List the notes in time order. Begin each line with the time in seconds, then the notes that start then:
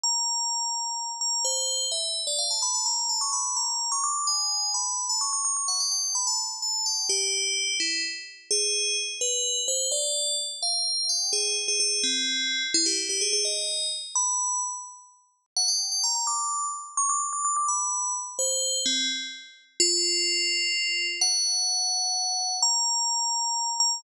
0.04 A#5
1.21 A#5
1.45 C5
1.92 E5
2.27 D5
2.39 F5
2.51 A5
2.62 B5
2.74 A5
2.86 A#5
3.09 A5
3.21 C#6
3.33 B5
3.56 A#5
3.92 C#6
4.04 D6
4.27 G#5
4.74 B5
5.09 A5
5.21 C#6
5.33 C#6
5.45 C#6
5.57 C#6
5.68 F#5
5.80 G5
5.92 G5
6.04 G5
6.15 B5
6.27 A5
6.62 A5
6.86 G5
7.09 G4
7.80 E4
8.51 G#4
9.21 B4
9.68 C5
9.92 D5
10.63 F5
11.09 G5
11.33 G#4
11.68 G#4
11.80 G#4
12.04 C4
12.74 E4
12.86 G4
13.09 G4
13.21 G#4
13.33 G#4
13.45 D#5
14.15 B5
15.57 F#5
15.68 G5
15.92 G5
16.04 A#5
16.15 A#5
16.27 D6
16.97 C#6
17.09 D6
17.33 D6
17.45 D6
17.56 D6
17.68 B5
18.39 C5
18.86 C4
19.80 F4
21.21 F#5
22.63 A#5
23.80 A#5